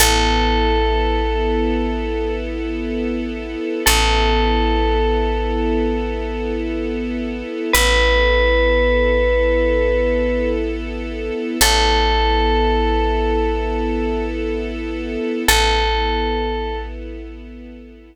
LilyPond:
<<
  \new Staff \with { instrumentName = "Tubular Bells" } { \time 4/4 \key a \mixolydian \tempo 4 = 62 a'2. r4 | a'2. r4 | b'2. r4 | a'2. r4 |
a'4. r2 r8 | }
  \new Staff \with { instrumentName = "Electric Bass (finger)" } { \clef bass \time 4/4 \key a \mixolydian a,,1 | a,,1 | a,,1 | a,,1 |
a,,1 | }
  \new Staff \with { instrumentName = "String Ensemble 1" } { \time 4/4 \key a \mixolydian <b e' a'>1 | <b e' a'>1 | <b e' a'>1 | <b e' a'>1 |
<b e' a'>1 | }
>>